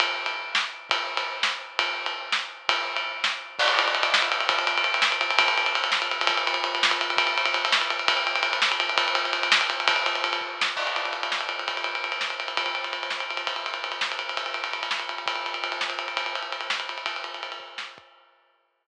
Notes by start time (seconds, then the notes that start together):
0.00 kick, ride
0.26 ride
0.55 snare
0.90 kick, ride
1.17 ride
1.43 snare
1.79 kick, ride
2.06 ride
2.32 snare
2.69 kick, ride
2.96 ride
3.24 snare
3.59 kick, crash
3.68 ride
3.79 ride
3.88 ride
3.95 ride
4.03 ride
4.14 snare
4.22 ride
4.32 ride
4.40 ride
4.49 kick, ride
4.59 ride
4.67 ride
4.78 ride
4.84 ride
4.94 ride
5.02 snare
5.12 ride
5.21 ride
5.30 ride
5.39 kick, ride
5.48 ride
5.58 ride
5.66 ride
5.75 ride
5.84 ride
5.92 snare
6.02 ride
6.11 ride
6.21 ride
6.27 kick, ride
6.37 ride
6.47 ride
6.54 ride
6.64 ride
6.75 ride
6.83 snare
6.91 ride
7.01 ride
7.10 ride
7.17 kick, ride
7.27 ride
7.38 ride
7.46 ride
7.54 ride
7.65 ride
7.72 snare
7.81 ride
7.90 ride
7.99 ride
8.08 kick, ride
8.17 ride
8.27 ride
8.35 ride
8.43 ride
8.53 ride
8.62 snare
8.72 ride
8.80 ride
8.89 ride
8.98 kick, ride
9.08 ride
9.15 ride
9.25 ride
9.33 ride
9.43 ride
9.52 snare
9.61 ride
9.70 ride
9.80 ride
9.88 kick, ride
9.96 ride
10.06 ride
10.15 ride
10.24 ride
10.33 ride
10.41 kick
10.61 snare
10.76 kick, crash
10.87 ride
10.96 ride
11.05 ride
11.13 ride
11.23 ride
11.32 snare
11.41 ride
11.49 ride
11.59 ride
11.68 kick, ride
11.77 ride
11.84 ride
11.95 ride
12.04 ride
12.12 ride
12.21 snare
12.30 ride
12.40 ride
12.48 ride
12.57 kick, ride
12.66 ride
12.75 ride
12.84 ride
12.93 ride
13.03 ride
13.10 snare
13.20 ride
13.30 ride
13.37 ride
13.47 kick, ride
13.56 ride
13.66 ride
13.74 ride
13.84 ride
13.92 ride
14.01 snare
14.12 ride
14.19 ride
14.29 ride
14.37 kick, ride
14.46 ride
14.54 ride
14.64 ride
14.73 ride
14.83 ride
14.91 snare
14.99 ride
15.09 ride
15.18 ride
15.26 kick, ride
15.35 ride
15.46 ride
15.54 ride
15.64 ride
15.72 ride
15.81 snare
15.90 ride
15.99 ride
16.08 ride
16.17 kick, ride
16.26 ride
16.35 ride
16.43 ride
16.52 ride
16.61 ride
16.70 snare
16.80 ride
16.89 ride
16.98 ride
17.06 kick, ride
17.16 ride
17.24 ride
17.34 ride
17.43 ride
17.52 ride
17.60 kick
17.78 snare
17.98 kick